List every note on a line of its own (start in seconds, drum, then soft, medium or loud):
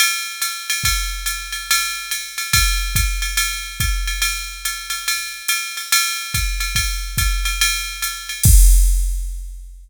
0.00 ride loud
0.42 hi-hat pedal medium
0.42 ride medium
0.70 ride medium
0.84 kick medium
0.84 ride medium
1.26 hi-hat pedal medium
1.26 ride medium
1.52 ride medium
1.71 ride loud
2.11 hi-hat pedal medium
2.11 ride medium
2.38 ride medium
2.53 kick medium
2.53 ride loud
2.95 kick medium
2.95 hi-hat pedal medium
2.95 ride medium
3.22 ride medium
3.37 ride medium
3.80 kick medium
3.80 hi-hat pedal medium
3.80 ride medium
4.07 ride medium
4.22 ride medium
4.65 hi-hat pedal medium
4.65 ride medium
4.90 ride medium
5.08 ride medium
5.48 hi-hat pedal medium
5.48 ride medium
5.77 ride medium
5.92 ride loud
6.34 kick medium
6.34 hi-hat pedal medium
6.34 ride medium
6.60 ride medium
6.75 kick medium
6.75 ride medium
7.18 kick medium
7.18 hi-hat pedal medium
7.18 ride medium
7.45 ride medium
7.61 ride loud
8.02 hi-hat pedal medium
8.02 ride medium
8.29 ride medium
8.43 kick loud
8.43 crash loud